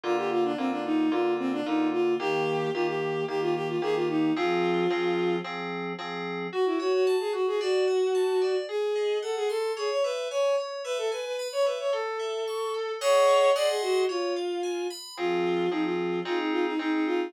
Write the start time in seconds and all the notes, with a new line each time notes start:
0.03 D3 A#3 F4
0.17 G4
0.31 F4
0.44 D4
0.58 D3 A#3 C4 F4
0.71 D4
0.85 D#4
1.11 D3 A#3 F4
1.39 C4
1.52 D4
1.66 D3 A#3 D#4 F4
1.93 F4
2.19 D#3 A#3 G4
2.74 D#3 A#3 F4 G4
2.88 G4
3.28 D#3 A#3 G4
3.41 F4
3.55 G4
3.68 F4
3.82 D#3 A#3 G4 G#4
3.95 F4
4.09 D#4
4.36 F3 C4 F4 G#4
4.90 F3 C4 G#4
5.44 F3 C4 G#4
5.98 F3 C4 G#4
6.52 F#4
6.66 E4
6.79 F#4 C#5
6.93 F#4
7.07 A5
7.20 G#4
7.33 F#4
7.47 G#4
7.60 F#4 D5
7.87 F#5
8.15 A5
8.41 D5
8.69 G#4
8.95 D#5
9.22 A4 F#5
9.36 G#4
9.49 A4 C6
9.77 G#4 C#5
9.90 C#5
10.04 B4 E5
10.30 C#5 G#5
10.58 C#5
10.84 B4 E5
10.98 A4
11.11 B4 G#5
11.25 B4
11.39 B5
11.52 C#5
11.66 B4 E5
11.79 C#5
11.93 A4
12.19 E5
12.47 C#6
12.74 A4
13.01 G#4 C#5 D#5 F#5 C#6
13.55 G#4 D5 D#5 F#5 C6
13.69 G#4
13.82 F#4
14.09 F4 C#5
14.36 F5
14.63 G#5
14.90 B5
15.17 F3 C4 F4 G#4
15.71 F3 C4 D#4 G#4
15.85 F4
16.25 C4 D#4 F4 G#4
16.39 D#4
16.52 F4
16.66 D#4
16.79 C4 D#4 G#4
16.93 D#4
17.06 F4